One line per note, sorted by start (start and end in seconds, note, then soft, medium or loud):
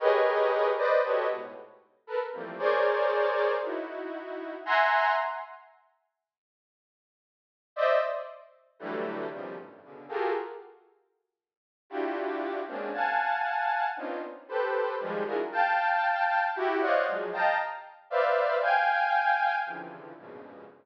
0.00 0.70 G4 loud
0.00 0.70 G#4 loud
0.00 0.70 A#4 loud
0.00 0.70 B4 loud
0.00 0.70 C#5 loud
0.00 0.70 D#5 loud
0.78 1.01 B4 loud
0.78 1.01 C5 loud
0.78 1.01 D5 loud
0.78 1.01 D#5 loud
1.03 1.27 F#4 medium
1.03 1.27 G4 medium
1.03 1.27 A4 medium
1.03 1.27 B4 medium
1.03 1.27 C#5 medium
1.03 1.27 D#5 medium
1.29 1.53 G#2 medium
1.29 1.53 A2 medium
1.29 1.53 B2 medium
2.07 2.19 A4 medium
2.07 2.19 A#4 medium
2.07 2.19 B4 medium
2.33 2.56 E3 medium
2.33 2.56 F3 medium
2.33 2.56 G3 medium
2.33 2.56 A3 medium
2.33 2.56 A#3 medium
2.33 2.56 C4 medium
2.59 3.52 G#4 medium
2.59 3.52 A#4 medium
2.59 3.52 C5 medium
2.59 3.52 C#5 medium
2.59 3.52 D5 medium
3.62 4.55 D#4 medium
3.62 4.55 E4 medium
3.62 4.55 F#4 medium
4.66 5.12 E5 loud
4.66 5.12 F#5 loud
4.66 5.12 G#5 loud
4.66 5.12 A#5 loud
4.66 5.12 C6 loud
7.76 7.99 C5 loud
7.76 7.99 D5 loud
7.76 7.99 D#5 loud
7.76 7.99 E5 loud
8.79 9.26 D3 loud
8.79 9.26 E3 loud
8.79 9.26 F#3 loud
8.79 9.26 G3 loud
8.79 9.26 A3 loud
9.31 9.54 B2 medium
9.31 9.54 C3 medium
9.31 9.54 C#3 medium
9.31 9.54 D#3 medium
9.31 9.54 F3 medium
9.31 9.54 G3 medium
9.57 9.80 F#2 medium
9.57 9.80 G2 medium
9.57 9.80 A2 medium
9.83 10.06 B2 medium
9.83 10.06 C#3 medium
9.83 10.06 D3 medium
10.09 10.32 F4 medium
10.09 10.32 F#4 medium
10.09 10.32 G4 medium
10.09 10.32 G#4 medium
10.09 10.32 A4 medium
10.09 10.32 A#4 medium
11.90 12.59 D4 medium
11.90 12.59 E4 medium
11.90 12.59 F4 medium
11.90 12.59 F#4 medium
11.90 12.59 G4 medium
12.67 12.91 G#3 medium
12.67 12.91 A#3 medium
12.67 12.91 C4 medium
12.67 12.91 C#4 medium
12.67 12.91 D4 medium
12.93 13.86 F5 medium
12.93 13.86 F#5 medium
12.93 13.86 G#5 medium
12.93 13.86 A5 medium
13.97 14.20 B3 medium
13.97 14.20 C4 medium
13.97 14.20 C#4 medium
13.97 14.20 D4 medium
13.97 14.20 D#4 medium
13.97 14.20 F4 medium
14.48 14.95 G4 medium
14.48 14.95 A4 medium
14.48 14.95 B4 medium
14.48 14.95 C5 medium
15.00 15.23 D#3 loud
15.00 15.23 F3 loud
15.00 15.23 G3 loud
15.00 15.23 G#3 loud
15.26 15.37 D4 medium
15.26 15.37 E4 medium
15.26 15.37 F4 medium
15.26 15.37 F#4 medium
15.26 15.37 G#4 medium
15.26 15.37 A#4 medium
15.52 16.45 F5 medium
15.52 16.45 G5 medium
15.52 16.45 A5 medium
16.55 16.79 E4 loud
16.55 16.79 F#4 loud
16.55 16.79 G4 loud
16.81 17.04 C5 medium
16.81 17.04 C#5 medium
16.81 17.04 D5 medium
16.81 17.04 D#5 medium
16.81 17.04 F5 medium
16.81 17.04 F#5 medium
17.07 17.30 F3 medium
17.07 17.30 F#3 medium
17.07 17.30 G#3 medium
17.33 17.56 D#5 medium
17.33 17.56 F5 medium
17.33 17.56 G5 medium
17.33 17.56 A5 medium
17.33 17.56 A#5 medium
18.10 18.57 B4 medium
18.10 18.57 C5 medium
18.10 18.57 D5 medium
18.10 18.57 E5 medium
18.10 18.57 F5 medium
18.62 19.55 F5 medium
18.62 19.55 G5 medium
18.62 19.55 G#5 medium
19.66 20.12 C3 medium
19.66 20.12 C#3 medium
19.66 20.12 D3 medium
19.66 20.12 E3 medium
19.66 20.12 F3 medium
20.17 20.64 F2 medium
20.17 20.64 G2 medium
20.17 20.64 G#2 medium
20.17 20.64 A#2 medium
20.17 20.64 B2 medium
20.17 20.64 C#3 medium